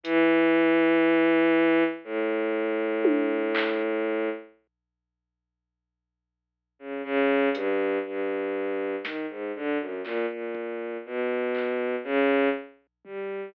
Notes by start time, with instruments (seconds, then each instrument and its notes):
0.04 violin E3, closed hi-hat
2.04 violin A2
3.05 high tom
3.55 clap
6.79 violin C#3
7.04 violin C#3
7.54 violin G2, closed hi-hat
8.06 violin G2
9.04 violin D#3, snare
9.29 violin G#2
9.55 violin D3
9.79 violin F#2
10.04 violin A#2, clap
10.30 violin A#2
10.55 kick
11.06 violin B2
11.55 clap
12.04 violin C#3
13.05 violin G3, floor tom